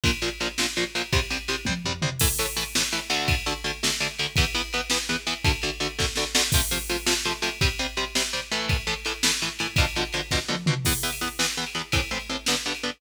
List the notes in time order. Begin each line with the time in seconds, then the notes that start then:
0.04 A#1 A#2 F3, kick, ride
0.22 A#1 A#2 F3, ride
0.40 A#1 A#2 F3, ride
0.58 A#1 A#2 F3, snare
0.76 A#1 A#2 F3, ride
0.95 A#1 A#2 F3, ride
1.13 C2 C3 G3, kick, ride
1.30 C2 C3 G3, ride
1.48 C2 C3 G3, ride
1.65 C2 C3 G3, kick, high tom
1.85 C2 C3 G3, floor tom
2.02 C2 C3 G3, mid tom
2.19 A2 E3 A3, kick, crash
2.39 A2 E3 A3, ride
2.56 A2 E3 A3, ride
2.75 A2 E3 A3, snare
2.92 A2 E3 A3, ride
3.10 D2 D3 A3, ride
3.28 kick, ride
3.46 D2 D3 A3, ride
3.64 D2 D3 A3, ride
3.83 D2 D3 A3, snare
4.00 D2 D3 A3, ride
4.19 D2 D3 A3, ride
4.36 E2 E3 B3, kick, ride
4.54 E2 E3 B3, ride
4.73 E2 E3 B3, ride
4.90 E2 E3 B3, snare
5.09 E2 E3 B3, ride
5.27 E2 E3 B3, ride
5.44 D2 D3 A3, kick, ride
5.62 D2 D3 A3, ride
5.80 D2 D3 A3, ride
5.98 D2 D3 A3, kick, snare
6.16 D2 D3 A3, snare
6.35 D2 D3 A3, snare
6.52 C3 F3 A3, kick, crash
6.71 C3 F3 A3, ride
6.89 C3 F3 A3, ride
7.06 C3 F3 A3, snare
7.25 C3 F3 A3, ride
7.42 C3 F3 A3, ride
7.61 C3 G3 C4, kick, ride
7.79 C3 G3 C4, ride
7.97 C3 G3 C4, ride
8.15 C3 G3 C4, snare
8.33 C3 G3 C4, ride
8.51 A2 E3 A3, ride
8.69 kick, ride
8.87 A2 E3 A3, ride
9.05 A2 E3 A3, ride
9.23 A2 E3 A3, snare
9.41 A2 E3 A3, ride
9.59 A2 E3 A3, ride
9.76 B2 D3 F3, kick, ride
9.95 B2 D3 F3, ride
10.13 B2 D3 F3, ride
10.31 B2 D3 F3, kick, snare
10.48 B2 D3 F3, high tom
10.66 B2 D3 F3, mid tom
10.85 E2 E3 B3, kick, crash
11.03 E2 E3 B3
11.12 ride
11.21 E2 E3 B3
11.39 E2 E3 B3, snare
11.57 E2 E3 B3
11.66 ride
11.75 E2 E3 B3
11.92 A2 E3 C4, kick, ride
12.11 A2 E3 C4
12.19 ride
12.29 A2 E3 C4
12.46 G2 D3 B3, snare
12.66 G2 D3 B3
12.75 ride
12.83 G2 D3 B3